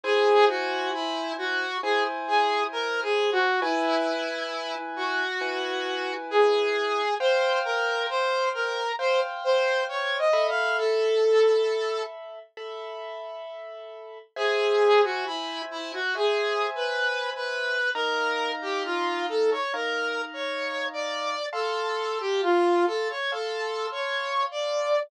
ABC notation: X:1
M:4/4
L:1/16
Q:1/4=67
K:Abmix
V:1 name="Lead 2 (sawtooth)"
A2 G2 _F2 G2 A z A2 (3B2 A2 G2 | _F6 G6 A4 | c2 B2 c2 B2 c z c2 (3d2 e2 f2 | =A6 z10 |
[K:Amix] ^G3 F E2 E F (3G4 B4 B4 | ^A3 G ^E2 =A c (3^A4 c4 d4 | A3 G =F2 A c (3A4 c4 d4 |]
V:2 name="Acoustic Grand Piano"
[_Fca]8 [Fca]8 | [_F_ca]8 [Fca]8 | [cf=g]8 [cfg]6 [=A=e=b]2- | [=A=e=b]8 [Aeb]8 |
[K:Amix] [=ce^g]8 [ceg]8 | [^D^e^a]8 [Dea]8 | [=fa=c']8 [fac']8 |]